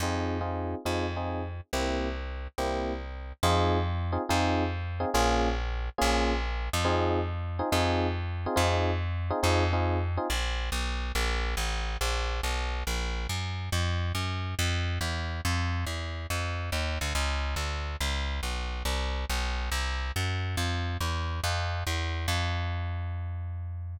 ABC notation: X:1
M:4/4
L:1/8
Q:"Swing" 1/4=140
K:Fm
V:1 name="Electric Piano 1"
[CEFA]2 [CEFA]2 [CEFA] [CEFA]3 | [B,C=EG]4 [B,CEG]4 | [CEFA]3 [CEFA] [CEFA]3 [CEFA] | [B,DFA]4 [B,DFA]4 |
[CEFA]3 [CEFA] [CEFA]3 [CEFA] | [CEFA]3 [CEFA] [CEFA] [CEFA]2 [CEFA] | z8 | z8 |
z8 | z8 | z8 | z8 |
z8 | z8 |]
V:2 name="Electric Bass (finger)" clef=bass
F,,4 F,,4 | C,,4 C,,4 | F,,4 F,,4 | B,,,4 B,,,3 F,,- |
F,,4 F,,4 | F,,4 F,,4 | B,,,2 =B,,,2 _B,,,2 =A,,,2 | B,,,2 =B,,,2 _B,,,2 _G,,2 |
F,,2 _G,,2 F,,2 =E,,2 | F,,2 =E,,2 F,,2 _E,, =D,, | D,,2 =D,,2 _D,,2 _C,,2 | C,,2 =B,,,2 C,,2 _G,,2 |
F,,2 =E,,2 F,,2 E,,2 | F,,8 |]